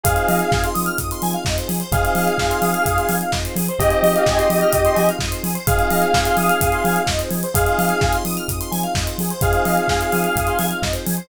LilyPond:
<<
  \new Staff \with { instrumentName = "Lead 2 (sawtooth)" } { \time 4/4 \key f \minor \tempo 4 = 128 <aes' f''>4. r2 r8 | <aes' f''>2. r4 | <g' ees''>2. r4 | <aes' f''>2. r4 |
<aes' f''>4. r2 r8 | <aes' f''>2. r4 | }
  \new Staff \with { instrumentName = "Electric Piano 1" } { \time 4/4 \key f \minor <c' ees' f' aes'>1 | <c' ees' f' aes'>1 | <c' ees' f' aes'>1 | <c' ees' f' aes'>1 |
<c' ees' f' aes'>1 | <c' ees' f' aes'>1 | }
  \new Staff \with { instrumentName = "Lead 1 (square)" } { \time 4/4 \key f \minor aes'16 c''16 ees''16 f''16 aes''16 c'''16 ees'''16 f'''16 ees'''16 c'''16 aes''16 f''16 ees''16 c''16 aes'16 c''16 | aes'16 c''16 ees''16 f''16 aes''16 c'''16 ees'''16 f'''16 ees'''16 c'''16 aes''16 f''16 ees''16 c''16 aes'16 c''16 | aes'16 c''16 ees''16 f''16 aes''16 c'''16 ees'''16 f'''16 ees'''16 c'''16 aes''16 f''16 ees''16 c''16 aes'16 c''16 | aes'16 c''16 ees''16 f''16 aes''16 c'''16 ees'''16 f'''16 ees'''16 c'''16 aes''16 f''16 ees''16 c''16 aes'16 c''16 |
aes'16 c''16 ees''16 f''16 aes''16 c'''16 ees'''16 f'''16 ees'''16 c'''16 aes''16 f''16 ees''16 c''16 aes'16 c''16 | aes'16 c''16 ees''16 f''16 aes''16 c'''16 ees'''16 f'''16 ees'''16 c'''16 aes''16 f''16 ees''16 c''16 aes'16 c''16 | }
  \new Staff \with { instrumentName = "Synth Bass 2" } { \clef bass \time 4/4 \key f \minor f,8 f8 f,8 f8 f,8 f8 f,8 f8 | f,8 f8 f,8 f8 f,8 f8 f,8 f8 | f,8 f8 f,8 f8 f,8 f8 f,8 f8 | f,8 f8 f,8 f8 f,8 f8 f,8 f8 |
f,8 f8 f,8 f8 f,8 f8 f,8 f8 | f,8 f8 f,8 f8 f,8 f8 f,8 f8 | }
  \new DrumStaff \with { instrumentName = "Drums" } \drummode { \time 4/4 <hh bd>16 hh16 hho16 hh16 <bd sn>16 hh16 hho16 hh16 <hh bd>16 hh16 hho16 hh16 <bd sn>16 hh16 hho16 hh16 | <hh bd>16 hh16 hho16 hh16 <bd sn>16 hh16 hho16 hh16 <hh bd>16 hh16 hho16 hh16 <bd sn>16 hh16 hho16 hh16 | <hh bd>16 hh16 hho16 hh16 <bd sn>16 hh16 hho16 hh16 <hh bd>16 hh16 hho16 hh16 <bd sn>16 hh16 hho16 hh16 | <hh bd>16 hh16 hho16 hh16 <bd sn>16 hh16 hho16 hh16 <hh bd>16 hh16 hho16 hh16 <bd sn>16 hh16 hho16 hh16 |
<hh bd>16 hh16 hho16 hh16 <bd sn>16 hh16 hho16 hh16 <hh bd>16 hh16 hho16 hh16 <bd sn>16 hh16 hho16 hh16 | <hh bd>16 hh16 hho16 hh16 <bd sn>16 hh16 hho16 hh16 <hh bd>16 hh16 hho16 hh16 <bd sn>16 hh16 hho16 hh16 | }
>>